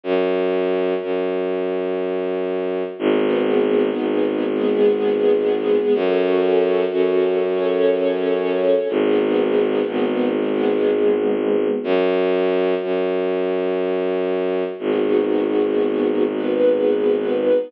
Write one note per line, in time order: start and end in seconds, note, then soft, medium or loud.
0.03 0.94 F#2 medium
1.02 2.83 F#2 medium
2.99 3.89 G#1 loud
2.99 4.45 B3 loud
2.99 4.45 D#4 loud
2.99 4.45 G#4 loud
3.97 5.78 G#1 medium
4.48 5.94 G#3 loud
4.48 5.94 B3 loud
4.48 5.94 G#4 loud
5.93 6.84 F#2 loud
5.93 7.39 C#4 loud
5.93 7.39 F#4 loud
5.93 7.39 A4 loud
6.92 8.73 F#2 medium
7.42 8.88 C#4 loud
7.42 8.88 A4 loud
7.42 8.88 C#5 loud
8.88 9.80 G#1 loud
8.88 10.34 B3 loud
8.88 10.34 D#4 loud
8.88 10.34 G#4 loud
9.87 11.68 G#1 medium
10.38 11.84 G#3 loud
10.38 11.84 B3 loud
10.38 11.84 G#4 loud
11.84 12.74 F#2 loud
12.82 14.64 F#2 medium
14.78 17.51 G#1 medium
14.78 16.24 B3 loud
14.78 16.24 D#4 loud
14.78 16.24 F#4 loud
14.78 16.24 G#4 medium
16.27 17.72 B3 medium
16.27 17.72 D#4 medium
16.27 17.72 G#4 medium
16.27 17.72 B4 loud